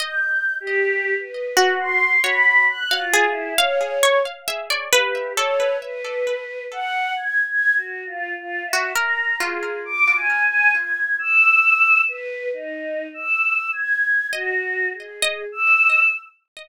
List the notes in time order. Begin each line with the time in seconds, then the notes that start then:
0.00 D#5 G6
0.60 G4
1.19 B4
1.57 F#4
1.80 C6
2.24 C#5 B5
2.69 F#6
2.91 F5
2.98 F4
3.13 G#4
3.29 E4
3.58 C#5 F5
4.03 C#5
4.48 E5
4.70 D5
4.93 G4 B4
5.36 A4 C#5
5.82 B4
6.72 F#5
7.16 G#6
7.47 G#6
7.76 F#4
8.06 F4
8.36 F4
8.65 E5
8.73 F#4
8.96 A#4 A#5
9.40 F4 G#4
9.85 D6
10.16 G#5
10.45 G#5
10.75 G#6
11.19 E6
12.08 B4
12.53 D#4
13.14 E6
13.73 G#6
14.32 F#4 D#5
14.93 G#4
15.22 D#5
15.52 E6